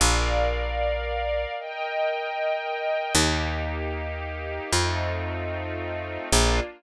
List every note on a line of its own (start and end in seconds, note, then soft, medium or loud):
0.00 1.46 A#1 medium
0.00 1.54 A#4 medium
0.00 1.54 D5 medium
0.00 1.54 F5 medium
1.59 3.13 A#4 medium
1.59 3.13 D#5 medium
1.59 3.13 G5 medium
3.15 4.60 D#2 loud
3.15 4.70 A#3 medium
3.15 4.70 D#4 medium
3.15 4.70 G4 medium
4.73 6.18 F2 medium
4.73 6.28 A3 medium
4.73 6.28 C4 medium
4.73 6.28 D#4 medium
4.73 6.28 F4 medium
6.32 6.60 A#1 loud
6.32 6.61 A#3 loud
6.32 6.61 D4 loud
6.32 6.61 F4 loud